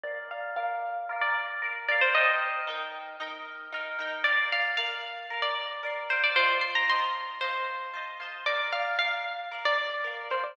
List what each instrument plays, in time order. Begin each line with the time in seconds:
0.04 orchestral harp A#4 D5 F5, pizzicato strings D5
0.31 pizzicato strings F5
0.56 orchestral harp A#4 D5 F5, pizzicato strings F5
1.09 orchestral harp A#4 D5 F5
1.21 pizzicato strings D5
1.62 orchestral harp A#4 D5 F5
1.88 orchestral harp A#4 D5 F5, pizzicato strings D5
2.01 pizzicato strings C5
2.15 orchestral harp D#4 A#4 G5, pizzicato strings D#5
2.67 orchestral harp D#4 A#4 G5
3.20 orchestral harp D#4 A#4 G5
3.72 orchestral harp D#4 A#4 G5
3.99 orchestral harp D#4 A#4 G5
4.24 orchestral harp A#4 D5, pizzicato strings D5
4.28 orchestral harp F5
4.52 pizzicato strings F5
4.77 orchestral harp A#4 D5 F5, pizzicato strings F5
5.30 orchestral harp A#4 D5 F5
5.42 pizzicato strings D5
5.83 orchestral harp A#4 D5 F5
6.09 orchestral harp A#4 D5 F5, pizzicato strings C5
6.24 pizzicato strings D5
6.36 orchestral harp F4 C5 D#5, pizzicato strings C5
6.40 orchestral harp A5
6.61 pizzicato strings C6
6.75 pizzicato strings A#5
6.88 orchestral harp F4 C5 D#5, pizzicato strings C6
6.93 orchestral harp A5
7.41 orchestral harp F4 C5 D#5, pizzicato strings C5
7.46 orchestral harp A5
7.94 orchestral harp F4 C5 D#5
7.98 orchestral harp A5
8.20 orchestral harp F4 C5 D#5
8.25 orchestral harp A5
8.46 orchestral harp A#4 D5 F5, pizzicato strings D5
8.73 pizzicato strings F5
8.99 orchestral harp A#4 D5 F5, pizzicato strings F5
9.51 orchestral harp A#4 D5 F5
9.65 pizzicato strings D5
10.04 orchestral harp A#4 D5 F5
10.30 orchestral harp A#4 D5 F5, pizzicato strings C5
10.44 pizzicato strings D5